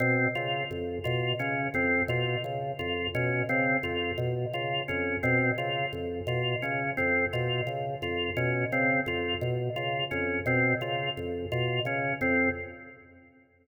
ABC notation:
X:1
M:3/4
L:1/8
Q:1/4=86
K:none
V:1 name="Drawbar Organ" clef=bass
B,, _D, F,, B,, D, F,, | B,, _D, F,, B,, D, F,, | B,, _D, F,, B,, D, F,, | B,, _D, F,, B,, D, F,, |
B,, _D, F,, B,, D, F,, | B,, _D, F,, B,, D, F,, |]
V:2 name="Drawbar Organ"
C F z F _D C | F z F _D C F | z F _D C F z | F _D C F z F |
_D C F z F D | C F z F _D C |]